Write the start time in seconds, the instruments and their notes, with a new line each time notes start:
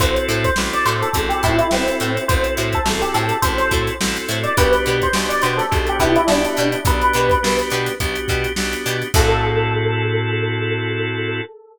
0.00 electric bass (finger) A1, drawbar organ C4 E4 F#4 A4, pizzicato strings E4 F#4 A4 C5, electric piano 1 C5, kick, closed hi-hat
0.16 closed hi-hat
0.28 electric bass (finger) A2, pizzicato strings E4 F#4 A4 C5, snare, closed hi-hat
0.44 electric piano 1 C5, kick, closed hi-hat
0.56 electric bass (finger) A1, drawbar organ C4 E4 F#4 A4, snare
0.73 electric piano 1 D5, closed hi-hat
0.85 electric bass (finger) A2, pizzicato strings E4 F#4 A4 C5, electric piano 1 C5, snare, closed hi-hat
1.02 electric piano 1 A4, closed hi-hat
1.13 electric bass (finger) A1, drawbar organ C4 E4 F#4 A4, kick, closed hi-hat
1.29 electric piano 1 G4, snare, closed hi-hat
1.43 electric bass (finger) A2, pizzicato strings E4 F#4 A4 C5, electric piano 1 E4, kick, closed hi-hat
1.58 electric piano 1 E4, closed hi-hat
1.71 electric bass (finger) A1, electric piano 1 C4, drawbar organ C4 E4 F#4 A4, snare
1.88 closed hi-hat
2.00 electric bass (finger) A2, pizzicato strings E4 F#4 A4 C5, closed hi-hat
2.17 closed hi-hat
2.28 electric bass (finger) A1, drawbar organ C4 E4 F#4 A4, electric piano 1 C5, kick, closed hi-hat
2.44 closed hi-hat
2.57 electric bass (finger) A2, pizzicato strings E4 F#4 A4 C5, closed hi-hat
2.73 electric piano 1 A4, kick, closed hi-hat
2.85 electric bass (finger) A1, drawbar organ C4 E4 F#4 A4, snare
3.02 electric piano 1 G4, closed hi-hat
3.14 electric bass (finger) A2, pizzicato strings E4 F#4 A4 C5, electric piano 1 A4, closed hi-hat
3.29 closed hi-hat
3.42 electric bass (finger) A1, drawbar organ C4 E4 F#4 A4, electric piano 1 C5, kick, closed hi-hat
3.58 electric piano 1 C5, snare, closed hi-hat
3.71 electric bass (finger) A2, pizzicato strings E4 F#4 A4 C5, kick, closed hi-hat
3.87 closed hi-hat
4.01 electric bass (finger) A1, drawbar organ C4 E4 F#4 A4, snare
4.16 closed hi-hat
4.28 electric bass (finger) A2, pizzicato strings E4 F#4 A4 C5, closed hi-hat
4.44 electric piano 1 D5, closed hi-hat
4.57 electric bass (finger) B1, drawbar organ B3 D4 F#4 G4, pizzicato strings D4 F#4 G4 B4, electric piano 1 B4, kick, closed hi-hat
4.73 snare, closed hi-hat
4.86 electric bass (finger) B2, pizzicato strings D4 F#4 G4 B4, closed hi-hat
5.02 electric piano 1 C5, kick, closed hi-hat
5.13 electric bass (finger) B1, drawbar organ B3 D4 F#4 G4, snare
5.29 electric piano 1 D5, closed hi-hat
5.42 electric bass (finger) B2, pizzicato strings D4 F#4 G4, electric piano 1 C5, closed hi-hat
5.46 pizzicato strings B4
5.57 electric piano 1 A4, snare, closed hi-hat
5.71 electric bass (finger) B1, drawbar organ B3 D4 F#4 G4, kick, closed hi-hat
5.87 electric piano 1 G4, closed hi-hat
5.99 electric bass (finger) B2, pizzicato strings D4 F#4 G4 B4, electric piano 1 E4, kick, closed hi-hat
6.16 electric piano 1 E4, closed hi-hat
6.27 electric bass (finger) B1, drawbar organ B3 D4 F#4 G4, electric piano 1 D4, snare
6.45 closed hi-hat
6.57 electric bass (finger) B2, pizzicato strings D4 F#4 G4 B4, closed hi-hat
6.72 closed hi-hat
6.85 electric bass (finger) B1, drawbar organ B3 D4 F#4 G4, electric piano 1 B4, kick, closed hi-hat
7.02 closed hi-hat
7.13 electric bass (finger) B2, pizzicato strings D4 F#4 G4 B4, closed hi-hat
7.30 kick, closed hi-hat
7.43 electric bass (finger) B1, drawbar organ B3 D4 F#4 G4, snare
7.59 closed hi-hat
7.70 electric bass (finger) B2, pizzicato strings D4 F#4 G4, closed hi-hat
7.74 pizzicato strings B4
7.86 snare, closed hi-hat
8.00 electric bass (finger) B1, drawbar organ B3 D4 F#4 G4, kick, closed hi-hat
8.15 closed hi-hat
8.28 electric bass (finger) B2, pizzicato strings D4 F#4 G4 B4, kick, snare, closed hi-hat
8.44 closed hi-hat
8.56 electric bass (finger) B1, drawbar organ B3 D4 F#4 G4, snare
8.73 closed hi-hat
8.86 electric bass (finger) B2, pizzicato strings D4 F#4 G4 B4, closed hi-hat
9.02 closed hi-hat
9.14 electric bass (finger) A2, drawbar organ C4 E4 F#4 A4, pizzicato strings E4 F#4 A4 C5, electric piano 1 A4, kick, crash